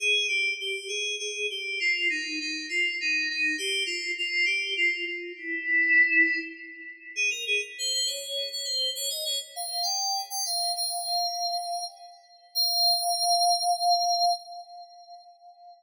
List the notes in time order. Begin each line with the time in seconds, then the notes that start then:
0.00 G#4
0.28 G4
0.60 G4
0.88 G#4
1.19 G#4
1.50 G4
1.80 F4
2.10 D#4
2.40 D#4
2.69 F4
3.00 D#4
3.29 D#4
3.58 G4
3.86 F4
4.18 F4
4.46 G4
4.76 F4
5.07 F4
5.37 E4
7.16 G#4
7.30 A#4
7.47 G#4
7.78 C5
7.93 C5
8.06 C#5
8.52 C#5
8.65 C5
8.95 C#5
9.10 D#5
9.25 C#5
9.56 F5
9.71 F5
9.83 G5
10.30 G5
10.45 F5
10.76 F5
12.55 F5